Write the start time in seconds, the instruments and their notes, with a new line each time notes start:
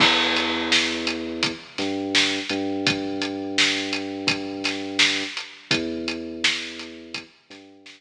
0.00 synth bass 2 E2, kick, crash
0.36 closed hi-hat
0.72 snare
1.07 closed hi-hat
1.43 kick, closed hi-hat
1.78 synth bass 2 G2, snare, closed hi-hat
2.15 snare
2.49 synth bass 2 G2, closed hi-hat
2.87 kick, closed hi-hat
3.22 closed hi-hat
3.58 snare
3.93 closed hi-hat
4.27 kick, closed hi-hat
4.64 snare, closed hi-hat
4.99 snare
5.37 closed hi-hat
5.71 synth bass 2 E2, kick, closed hi-hat
6.08 closed hi-hat
6.44 snare
6.79 closed hi-hat
7.14 kick, closed hi-hat
7.50 synth bass 2 G2, snare, closed hi-hat
7.86 snare